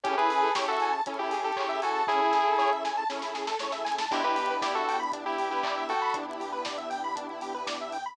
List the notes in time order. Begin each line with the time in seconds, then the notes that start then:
0.03 A1 C#4 E4 G4 G#4 A4, kick, closed hi-hat
0.17 E4 G#4 B4
0.30 A1 G#4, open hi-hat
0.43 A4
0.55 A1 C#4 E4 G4 G#4 A4 C#5, kick, snare
0.68 F#4 A4 E5
0.80 A1 G#5, open hi-hat
0.92 A5
1.06 A1 C#4 E4 G#4 A4, kick, closed hi-hat
1.19 E4 G4
1.31 A1 G#4, open hi-hat
1.44 G4 A4
1.56 A1 C#4 E4 G#4 A4 C#5, kick, clap
1.69 E5
1.82 A1 F#4 A4 G#5, open hi-hat
1.95 A5
2.07 A1 C#4 E4 G#4 A4, kick, snare
2.21 E4
2.33 A1 G#4, snare
2.47 A4
2.58 A1 C#4 E4 G#4 A4 C#5, snare
2.72 E5
2.84 A1 G#5, snare
2.97 A5
3.09 A1 C#4 E4 G#4 A4, snare
3.22 E4, snare
3.34 A1 G#4, snare
3.47 A4, snare
3.59 D2 C#4 E4 G#4 A4 C#5, snare
3.72 E5, snare
3.85 D#2 G#5, snare
3.98 A5, snare
4.11 E2 B3 D4 E4 G4, kick, crash
4.24 E4 G4 B4
4.36 E2 G4, open hi-hat
4.50 B4
4.62 E2 E4 G4 D5, kick, snare
4.75 F#4 A4 E5
4.88 E2 G5, open hi-hat
4.99 B5
5.12 E2 D4, kick, closed hi-hat
5.26 E4 G4
5.38 E2 G4, open hi-hat
5.51 E4 G4 B4
5.63 E2 D5, kick, clap
5.77 E5
5.89 E2 F#4 A4 G5, open hi-hat
6.02 B5
6.14 E2 B3 D4 E4 G4, kick, closed hi-hat
6.28 E4
6.40 E2 G4, open hi-hat
6.52 B4
6.65 E2 D5, kick, snare
6.78 E5
6.90 E2 G5, open hi-hat
7.04 B5
7.15 E2 D4, kick, closed hi-hat
7.30 E4
7.41 E2 G4, open hi-hat
7.54 B4
7.67 E2 D5, kick, snare
7.81 E5
7.92 E2 G5, open hi-hat
8.06 B5